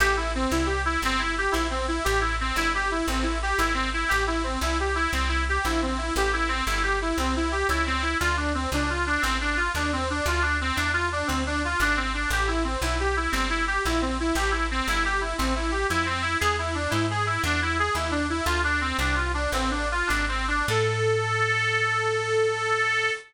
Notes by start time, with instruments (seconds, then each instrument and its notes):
0.00 electric bass (finger) A1, harmonica G4
0.17 harmonica E4
0.35 harmonica C4
0.51 electric bass (finger) C2, harmonica E4
0.66 harmonica G4
0.85 harmonica E4
1.02 electric bass (finger) G1, harmonica C4
1.19 harmonica E4
1.38 harmonica G4
1.52 electric bass (finger) A#1, harmonica E4
1.70 harmonica C4
1.88 harmonica E4
2.04 electric bass (finger) A1, harmonica G4
2.20 harmonica E4
2.40 harmonica C4
2.56 electric bass (finger) G1, harmonica E4
2.75 harmonica G4
2.91 harmonica E4
3.08 electric bass (finger) A1, harmonica C4
3.23 harmonica E4
3.42 harmonica G4
3.58 electric bass (finger) G#1, harmonica E4
3.74 harmonica C4
3.93 harmonica E4
4.08 electric bass (finger) A1, harmonica G4
4.27 harmonica E4
4.43 harmonica C4
4.61 electric bass (finger) C2, harmonica E4
4.80 harmonica G4
4.95 harmonica E4
5.12 electric bass (finger) C2, harmonica C4
5.28 harmonica E4
5.49 harmonica G4
5.65 electric bass (finger) A#1, harmonica E4
5.82 harmonica C4
5.98 harmonica E4
6.16 electric bass (finger) A1, harmonica G4
6.33 harmonica E4
6.48 harmonica C4
6.67 electric bass (finger) G1, harmonica E4
6.83 harmonica G4
7.01 harmonica E4
7.18 electric bass (finger) C2, harmonica C4
7.36 harmonica E4
7.52 harmonica G4
7.69 electric bass (finger) C#2, harmonica E4
7.86 harmonica C4
8.02 harmonica E4
8.20 electric bass (finger) D2, harmonica F4
8.37 harmonica D4
8.54 harmonica C4
8.72 electric bass (finger) C#2, harmonica D4
8.90 harmonica F4
9.06 harmonica D4
9.22 electric bass (finger) A1, harmonica C4
9.41 harmonica D4
9.57 harmonica F4
9.75 electric bass (finger) D#2, harmonica D4
9.93 harmonica C4
10.10 harmonica D4
10.26 electric bass (finger) D2, harmonica F4
10.42 harmonica D4
10.61 harmonica C4
10.76 electric bass (finger) E2, harmonica D4
10.93 harmonica F4
11.12 harmonica D4
11.27 electric bass (finger) D2, harmonica C4
11.46 harmonica D4
11.64 harmonica F4
11.80 electric bass (finger) G#1, harmonica D4
11.97 harmonica C4
12.14 harmonica D4
12.30 electric bass (finger) A1, harmonica G4
12.48 harmonica E4
12.64 harmonica C4
12.82 electric bass (finger) B1, harmonica E4
13.00 harmonica G4
13.17 harmonica E4
13.32 electric bass (finger) G1, harmonica C4
13.49 harmonica E4
13.67 harmonica G4
13.85 electric bass (finger) A#1, harmonica E4
14.02 harmonica C4
14.20 harmonica E4
14.35 electric bass (finger) A1, harmonica G4
14.51 harmonica E4
14.71 harmonica C4
14.88 electric bass (finger) G1, harmonica E4
15.05 harmonica G4
15.21 harmonica E4
15.38 electric bass (finger) A1, harmonica C4
15.56 harmonica E4
15.71 harmonica G4
15.90 electric bass (finger) F2, harmonica E4
16.06 harmonica C4
16.22 harmonica E4
16.40 electric bass (finger) E2, harmonica G#4
16.58 harmonica E4
16.75 harmonica D4
16.90 electric bass (finger) G#2, harmonica E4
17.10 harmonica G#4
17.26 harmonica E4
17.44 electric bass (finger) E2, harmonica D4
17.62 harmonica E4
17.79 harmonica G#4
17.95 electric bass (finger) D#2, harmonica E4
18.11 harmonica D4
18.30 harmonica E4
18.46 electric bass (finger) D2, harmonica F4
18.64 harmonica D4
18.81 harmonica C4
18.99 electric bass (finger) C2, harmonica D4
19.15 harmonica F4
19.34 harmonica D4
19.52 electric bass (finger) A1, harmonica C4
19.71 harmonica D4
19.91 harmonica F4
20.07 electric bass (finger) G#1, harmonica D4
20.28 harmonica C4
20.48 harmonica D4
20.68 electric bass (finger) A2, harmonica A4